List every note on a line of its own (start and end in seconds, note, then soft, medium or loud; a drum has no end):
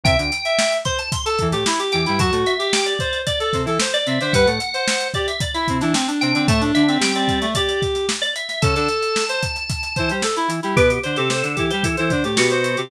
0.04 0.16 C2 medium
0.04 0.16 C3 medium
0.04 0.18 E5 medium
0.04 0.72 G5 medium
0.04 kick medium
0.04 closed hi-hat medium
0.18 0.31 D2 medium
0.18 0.31 D3 medium
0.18 closed hi-hat medium
0.32 closed hi-hat medium
0.45 0.78 E5 medium
0.45 closed hi-hat medium
0.59 snare medium
0.72 closed hi-hat medium
0.85 0.98 C5 medium
0.85 0.98 C6 medium
0.85 kick medium
0.85 closed hi-hat medium
0.99 1.11 A5 medium
0.99 closed hi-hat medium
1.12 1.25 C6 medium
1.12 kick medium
1.12 closed hi-hat medium
1.26 1.48 A4 medium
1.26 1.39 A5 medium
1.26 closed hi-hat medium
1.39 1.54 E2 medium
1.39 1.54 E3 medium
1.39 kick medium
1.39 closed hi-hat medium
1.51 1.64 A2 medium
1.51 1.64 A3 medium
1.51 1.65 G4 medium
1.51 closed hi-hat medium
1.66 1.79 E4 medium
1.66 snare medium
1.79 2.01 G4 medium
1.79 closed hi-hat medium
1.92 2.06 E2 medium
1.92 2.06 E3 medium
1.92 2.17 G5 medium
1.92 snare soft
1.92 closed hi-hat medium
2.06 2.21 G2 medium
2.06 2.21 G3 medium
2.06 2.19 E4 medium
2.06 closed hi-hat medium
2.18 2.31 F#2 medium
2.18 2.31 F#3 medium
2.18 2.53 F#4 medium
2.18 2.32 A5 medium
2.18 kick medium
2.18 closed hi-hat medium
2.32 2.45 A2 medium
2.32 2.45 A3 medium
2.32 closed hi-hat medium
2.46 2.72 E5 medium
2.46 closed hi-hat medium
2.59 2.94 G4 medium
2.59 closed hi-hat medium
2.73 2.86 G5 medium
2.73 snare medium
2.86 3.18 D5 medium
2.86 closed hi-hat medium
2.99 3.22 C5 medium
2.99 kick medium
2.99 closed hi-hat medium
3.13 closed hi-hat medium
3.27 3.39 D5 medium
3.27 3.40 D5 medium
3.27 kick medium
3.27 closed hi-hat medium
3.40 3.62 A4 medium
3.40 3.53 D5 medium
3.40 closed hi-hat medium
3.53 3.66 C3 medium
3.53 3.66 C4 medium
3.53 kick medium
3.53 snare soft
3.53 closed hi-hat medium
3.65 3.78 E3 medium
3.65 3.78 E4 medium
3.65 3.80 A4 medium
3.65 snare soft
3.65 closed hi-hat soft
3.80 3.93 C5 medium
3.80 snare loud
3.94 4.19 D5 medium
3.94 4.06 D5 medium
3.94 closed hi-hat medium
4.06 4.19 C3 medium
4.06 4.19 C4 medium
4.06 4.20 E5 medium
4.06 closed hi-hat medium
4.21 4.33 D3 medium
4.21 4.33 D4 medium
4.21 4.34 C5 medium
4.21 4.33 E5 medium
4.21 snare soft
4.21 closed hi-hat medium
4.33 4.46 G2 medium
4.33 4.46 G3 medium
4.33 4.47 B4 medium
4.33 5.08 F#5 medium
4.33 kick medium
4.33 closed hi-hat medium
4.46 4.59 A2 medium
4.46 4.59 A3 medium
4.46 closed hi-hat medium
4.60 closed hi-hat medium
4.74 5.08 C5 medium
4.74 closed hi-hat medium
4.88 snare medium
5.00 closed hi-hat medium
5.14 5.28 G4 medium
5.14 5.27 D5 medium
5.14 kick medium
5.14 closed hi-hat medium
5.28 5.40 E5 medium
5.28 closed hi-hat medium
5.41 5.54 D5 medium
5.41 kick medium
5.41 closed hi-hat medium
5.54 5.78 E4 medium
5.54 5.67 E5 medium
5.54 closed hi-hat medium
5.68 5.82 C3 medium
5.68 5.82 C4 medium
5.68 kick medium
5.68 closed hi-hat medium
5.81 5.94 E3 medium
5.81 5.94 D4 medium
5.81 5.94 E4 medium
5.81 snare soft
5.81 closed hi-hat medium
5.94 6.07 C4 medium
5.94 snare medium
6.07 6.32 D4 medium
6.07 closed hi-hat medium
6.21 6.34 C3 medium
6.21 6.34 C4 medium
6.21 6.43 G5 medium
6.21 closed hi-hat medium
6.34 6.47 D3 medium
6.34 6.48 C4 medium
6.34 6.47 D4 medium
6.34 closed hi-hat medium
6.47 6.72 A2 medium
6.47 6.72 A3 medium
6.47 6.61 A3 medium
6.47 6.61 A5 medium
6.47 kick medium
6.47 closed hi-hat medium
6.61 6.83 D4 medium
6.61 closed hi-hat medium
6.75 6.98 D3 medium
6.75 6.98 D4 medium
6.75 6.98 E5 medium
6.75 closed hi-hat medium
6.88 7.12 C4 medium
6.88 closed hi-hat medium
7.00 7.46 G3 medium
7.00 7.46 G4 medium
7.00 7.15 G5 medium
7.00 snare medium
7.15 7.39 C4 medium
7.15 7.49 D5 medium
7.15 closed hi-hat medium
7.28 kick medium
7.28 snare soft
7.28 closed hi-hat medium
7.41 7.54 A3 medium
7.41 closed hi-hat medium
7.55 8.06 G4 medium
7.55 7.68 D5 medium
7.55 kick medium
7.55 closed hi-hat medium
7.68 7.81 D5 medium
7.68 closed hi-hat medium
7.82 kick medium
7.82 snare soft
7.82 closed hi-hat medium
7.95 snare soft
7.95 closed hi-hat medium
8.09 snare medium
8.22 8.34 D5 medium
8.22 closed hi-hat medium
8.36 8.48 E5 medium
8.36 closed hi-hat medium
8.49 8.62 E5 medium
8.49 snare soft
8.49 closed hi-hat medium
8.62 8.75 C#3 medium
8.62 8.75 C#4 medium
8.62 8.75 A4 medium
8.62 10.09 A5 medium
8.62 kick medium
8.62 closed hi-hat medium
8.75 8.88 D3 medium
8.75 8.88 D4 medium
8.75 9.24 A4 medium
8.75 closed hi-hat medium
8.89 closed hi-hat medium
9.03 closed hi-hat medium
9.16 snare medium
9.29 9.42 C5 medium
9.29 closed hi-hat medium
9.43 kick medium
9.43 closed hi-hat medium
9.56 closed hi-hat medium
9.70 kick medium
9.70 closed hi-hat medium
9.83 closed hi-hat medium
9.96 10.11 E3 medium
9.96 10.11 E4 medium
9.96 10.09 C5 medium
9.96 kick medium
9.96 closed hi-hat medium
10.09 10.23 G3 medium
10.09 10.23 G4 medium
10.09 10.23 C5 medium
10.09 closed hi-hat medium
10.22 10.36 A4 medium
10.22 snare medium
10.36 10.49 E4 medium
10.36 closed hi-hat medium
10.48 10.60 E3 medium
10.48 10.60 E4 medium
10.48 closed hi-hat medium
10.63 10.76 G3 medium
10.63 10.75 E4 medium
10.63 10.76 G4 medium
10.63 closed hi-hat medium
10.76 10.99 B2 medium
10.76 10.99 B3 medium
10.76 11.00 G4 medium
10.76 10.89 B4 medium
10.76 kick medium
10.76 closed hi-hat medium
10.90 closed hi-hat medium
11.03 11.17 D3 medium
11.03 11.17 D4 medium
11.03 11.16 C5 medium
11.03 11.17 C5 medium
11.03 closed hi-hat medium
11.16 11.43 C3 medium
11.16 11.43 C4 medium
11.16 11.29 G4 medium
11.16 11.30 A4 medium
11.16 closed hi-hat medium
11.30 11.43 A4 medium
11.30 11.43 C5 medium
11.30 snare medium
11.43 11.56 D3 medium
11.43 11.56 D4 medium
11.43 11.66 A4 medium
11.43 closed hi-hat medium
11.56 11.71 E3 medium
11.56 11.71 E4 medium
11.56 11.82 G4 medium
11.56 kick medium
11.56 closed hi-hat medium
11.71 11.85 G3 medium
11.71 11.85 G4 medium
11.71 11.84 C5 medium
11.71 closed hi-hat medium
11.83 11.96 E3 medium
11.83 11.96 E4 medium
11.83 11.96 A4 medium
11.83 kick medium
11.83 closed hi-hat medium
11.97 12.12 E3 medium
11.97 12.12 E4 medium
11.97 12.10 A4 medium
11.97 12.10 C5 medium
11.97 closed hi-hat medium
12.10 12.24 D3 medium
12.10 12.24 D4 medium
12.10 12.23 C5 medium
12.10 kick medium
12.10 closed hi-hat medium
12.24 12.37 A2 soft
12.24 12.37 A3 medium
12.24 12.50 G4 medium
12.24 closed hi-hat medium
12.37 12.76 B2 medium
12.37 12.76 B3 medium
12.37 12.82 F#4 medium
12.37 snare medium
12.50 12.77 C5 medium
12.50 closed hi-hat medium
12.64 closed hi-hat medium
12.77 12.90 C3 medium
12.77 12.90 C4 medium
12.77 12.90 G4 medium
12.77 closed hi-hat medium